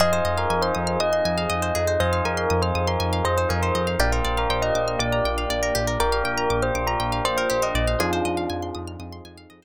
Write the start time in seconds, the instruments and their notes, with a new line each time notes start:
0.00 synth bass 1 F2, pad 2 (warm) C4 D#4 F4 G#4, pizzicato strings G#4, electric piano 1 C5 D#5 F5 G#5, tubular bells D#5
0.12 tubular bells C5, pizzicato strings C5
0.24 synth bass 1 F2, pizzicato strings D#5
0.38 tubular bells A#4, pizzicato strings F5
0.50 synth bass 1 F2, tubular bells A#4, pizzicato strings G#5
0.62 tubular bells C5, pizzicato strings C6
0.75 synth bass 1 F2, pizzicato strings D#6
0.87 pizzicato strings F6
1.00 synth bass 1 F2, tubular bells D#5, pizzicato strings D#6
1.13 pizzicato strings C6
1.25 synth bass 1 F2, pizzicato strings G#5
1.38 pizzicato strings F5
1.50 synth bass 1 F2, pizzicato strings D#5
1.62 pizzicato strings C5
1.75 synth bass 1 F2, pizzicato strings G#4
1.87 pizzicato strings C5
2.00 synth bass 1 F2, tubular bells C5, electric piano 1 C5 D#5 F5 G#5, pizzicato strings D#5
2.13 pizzicato strings F5
2.25 synth bass 1 F2, tubular bells A#4, pizzicato strings G#5
2.37 pizzicato strings C6
2.50 synth bass 1 F2, pizzicato strings D#6
2.62 tubular bells C5, pizzicato strings F6
2.75 synth bass 1 F2, pizzicato strings D#6
2.88 tubular bells A#4, pizzicato strings C6
3.00 synth bass 1 F2, pizzicato strings G#5
3.13 pizzicato strings F5
3.24 synth bass 1 F2, tubular bells C5, pizzicato strings D#5
3.38 pizzicato strings C5, tubular bells C5
3.49 synth bass 1 F2, pizzicato strings G#4, tubular bells A#4
3.62 tubular bells C5, pizzicato strings C5
3.75 synth bass 1 F2, pizzicato strings D#5
3.87 pizzicato strings F5
3.99 synth bass 1 A#1, pad 2 (warm) A#3 D4 F4 G4, pizzicato strings G4, electric piano 1 A#4 D5 F5 G5, tubular bells D5
4.12 pizzicato strings A#4, tubular bells C5
4.25 synth bass 1 A#1, pizzicato strings D5
4.37 tubular bells A#4, pizzicato strings F5
4.50 synth bass 1 A#1, tubular bells C5, pizzicato strings G5
4.62 tubular bells D#5, pizzicato strings A#5
4.75 synth bass 1 A#1, pizzicato strings D6
4.88 pizzicato strings F6
4.99 synth bass 1 A#1, tubular bells D5, pizzicato strings D6
5.12 pizzicato strings A#5
5.24 synth bass 1 A#1, pizzicato strings G5
5.38 pizzicato strings F5
5.50 synth bass 1 A#1, pizzicato strings D5
5.63 pizzicato strings A#4
5.75 synth bass 1 A#1, pizzicato strings G4
5.87 pizzicato strings A#4
6.00 synth bass 1 A#1, electric piano 1 A#4 D5 F5 G5, tubular bells A#4, pizzicato strings D5
6.12 pizzicato strings F5
6.24 synth bass 1 A#1, tubular bells A#4, pizzicato strings G5
6.38 pizzicato strings A#5
6.50 synth bass 1 A#1, pizzicato strings D6
6.62 tubular bells C5, pizzicato strings F6
6.75 synth bass 1 A#1, pizzicato strings D6
6.87 tubular bells A#4, pizzicato strings A#5
7.00 synth bass 1 A#1, pizzicato strings G5
7.12 pizzicato strings F5
7.25 synth bass 1 A#1, tubular bells C5, pizzicato strings D5
7.37 pizzicato strings A#4, tubular bells C5
7.50 synth bass 1 A#1, pizzicato strings G4, tubular bells C5
7.62 pizzicato strings A#4, tubular bells D#5
7.75 synth bass 1 A#1, pizzicato strings D5
7.88 pizzicato strings F5
7.99 synth bass 1 F2, electric piano 1 C4 D#4 F4 G#4, pad 2 (warm) C4 D#4 F4 G#4, tubular bells D4 F4, pizzicato strings G#4
8.13 pizzicato strings C5
8.25 synth bass 1 F2, pizzicato strings D#5
8.37 pizzicato strings F5
8.50 synth bass 1 F2, pizzicato strings G#5
8.62 pizzicato strings C6
8.75 synth bass 1 F2, pizzicato strings D#6
8.88 pizzicato strings F6
8.99 synth bass 1 F2, electric piano 1 C4 D#4 F4 G#4, pizzicato strings D#6
9.12 pizzicato strings C6
9.25 synth bass 1 F2, pizzicato strings G#5
9.38 pizzicato strings F5
9.50 synth bass 1 F2, pizzicato strings D#5
9.62 pizzicato strings C5